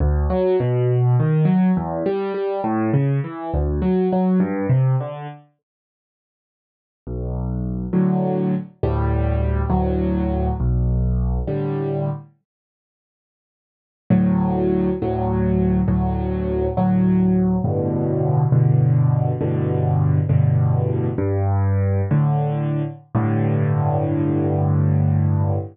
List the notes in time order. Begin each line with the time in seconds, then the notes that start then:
0.00 D2
0.30 F#3
0.60 B2
1.20 D#3
1.45 F#3
1.77 E2
2.06 G3
2.34 G3
2.64 A2
2.94 C#3
3.24 E3
3.54 D2
3.82 F#3
4.12 F#3
4.40 G2
4.69 C3
5.00 D3
7.07 B1
7.93 A2 D3 F#3
8.83 D2 A2 G3
9.70 D2 A2 F#3
10.60 B1
11.47 A2 D3 G3
14.10 D2 A2 F#3
15.02 D2 A2 F#3
15.88 D2 A2 F#3
16.77 D2 A2 F#3
17.64 G2 A2 B2 D3
18.52 G2 A2 B2 D3
19.41 G2 A2 B2 D3
20.29 G2 A2 B2 D3
21.18 G2
22.11 A2 D3
23.15 G2 A2 D3